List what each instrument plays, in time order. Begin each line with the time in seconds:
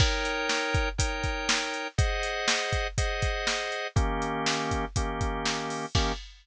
0.00 drawbar organ D#4 A#4 C#5 G5, kick, crash
0.25 closed hi-hat
0.49 snare
0.74 kick, closed hi-hat
0.98 drawbar organ D#4 A#4 C#5 G5, kick, closed hi-hat
1.23 kick, closed hi-hat
1.49 snare
1.74 closed hi-hat
1.98 drawbar organ G#4 C5 D#5 F#5, kick, closed hi-hat
2.23 closed hi-hat
2.48 snare
2.73 kick, closed hi-hat
2.98 drawbar organ G#4 C5 D#5 F#5, kick, closed hi-hat
3.22 kick, closed hi-hat
3.47 snare
3.72 closed hi-hat
3.96 drawbar organ D#3 A#3 C#4 G4, kick, closed hi-hat
4.22 closed hi-hat
4.46 snare
4.71 kick, closed hi-hat
4.96 drawbar organ D#3 A#3 C#4 G4, kick, closed hi-hat
5.21 kick, closed hi-hat
5.45 snare
5.70 open hi-hat
5.95 drawbar organ D#3 A#3 C#4 G4, kick, crash